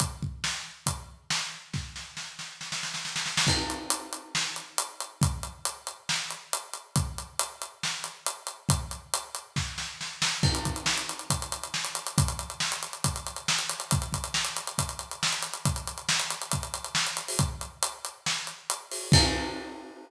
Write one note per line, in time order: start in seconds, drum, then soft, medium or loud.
0.00 kick medium
0.00 closed hi-hat medium
0.22 kick medium
0.44 snare medium
0.86 kick medium
0.86 closed hi-hat medium
1.30 snare medium
1.73 kick medium
1.73 snare soft
1.96 snare soft
2.17 snare medium
2.39 snare soft
2.61 snare soft
2.72 snare medium
2.83 snare medium
2.94 snare medium
3.05 snare medium
3.16 snare medium
3.26 snare medium
3.37 snare medium
3.47 kick medium
3.47 crash medium
3.70 closed hi-hat medium
3.90 closed hi-hat medium
4.13 closed hi-hat medium
4.35 snare medium
4.56 closed hi-hat soft
4.78 closed hi-hat medium
5.00 closed hi-hat medium
5.21 kick medium
5.21 closed hi-hat medium
5.43 closed hi-hat medium
5.65 closed hi-hat medium
5.87 closed hi-hat medium
6.09 snare medium
6.31 closed hi-hat medium
6.53 closed hi-hat medium
6.74 closed hi-hat medium
6.96 kick medium
6.96 closed hi-hat medium
7.18 closed hi-hat medium
7.39 closed hi-hat medium
7.62 closed hi-hat medium
7.83 snare medium
8.04 closed hi-hat medium
8.26 closed hi-hat medium
8.47 closed hi-hat medium
8.69 kick medium
8.69 closed hi-hat medium
8.91 closed hi-hat medium
9.14 closed hi-hat medium
9.35 closed hi-hat medium
9.56 kick medium
9.56 snare medium
9.78 snare medium
10.01 snare medium
10.22 snare medium
10.43 kick medium
10.43 crash medium
10.55 closed hi-hat medium
10.65 kick medium
10.65 closed hi-hat medium
10.76 closed hi-hat medium
10.86 snare medium
10.98 closed hi-hat medium
11.09 closed hi-hat medium
11.19 closed hi-hat soft
11.30 kick medium
11.30 closed hi-hat medium
11.42 closed hi-hat medium
11.52 closed hi-hat medium
11.63 closed hi-hat medium
11.74 snare medium
11.85 closed hi-hat medium
11.95 closed hi-hat medium
12.07 closed hi-hat medium
12.18 kick medium
12.18 closed hi-hat medium
12.28 closed hi-hat medium
12.39 closed hi-hat medium
12.50 closed hi-hat soft
12.60 snare medium
12.72 closed hi-hat medium
12.83 closed hi-hat medium
12.93 closed hi-hat soft
13.04 kick medium
13.04 closed hi-hat medium
13.16 closed hi-hat medium
13.27 closed hi-hat medium
13.36 closed hi-hat medium
13.48 snare medium
13.59 closed hi-hat medium
13.69 closed hi-hat medium
13.80 closed hi-hat medium
13.91 kick medium
13.91 closed hi-hat medium
14.02 closed hi-hat medium
14.13 kick medium
14.13 closed hi-hat medium
14.24 closed hi-hat medium
14.34 snare medium
14.45 closed hi-hat medium
14.57 closed hi-hat medium
14.67 closed hi-hat medium
14.78 kick medium
14.78 closed hi-hat medium
14.89 closed hi-hat medium
14.99 closed hi-hat medium
15.11 closed hi-hat medium
15.23 snare medium
15.33 closed hi-hat soft
15.42 closed hi-hat medium
15.54 closed hi-hat medium
15.65 kick medium
15.65 closed hi-hat medium
15.76 closed hi-hat medium
15.87 closed hi-hat medium
15.98 closed hi-hat soft
16.09 snare medium
16.20 closed hi-hat medium
16.30 closed hi-hat medium
16.42 closed hi-hat medium
16.52 kick medium
16.52 closed hi-hat medium
16.63 closed hi-hat medium
16.74 closed hi-hat medium
16.85 closed hi-hat medium
16.95 snare medium
17.07 closed hi-hat medium
17.17 closed hi-hat medium
17.28 open hi-hat medium
17.39 kick medium
17.39 closed hi-hat medium
17.61 closed hi-hat medium
17.83 closed hi-hat medium
18.05 closed hi-hat medium
18.26 snare medium
18.47 closed hi-hat soft
18.70 closed hi-hat medium
18.91 open hi-hat medium
19.12 kick loud
19.12 crash loud